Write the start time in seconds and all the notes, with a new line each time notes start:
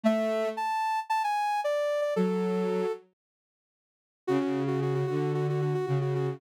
0.03 A3 E5
0.57 A5
1.10 A5
1.24 G#5
1.64 D5
2.01 D5
2.16 F#3 A4
4.27 C#3 F#4
4.41 F#4
4.67 F#4
4.82 F#4
4.94 F#4
5.07 D3 F#4
5.34 F#4
5.49 F#4
5.61 F#4
5.74 F#4
5.86 C#3 F#4
6.01 F#4
6.15 F#4
6.27 F#4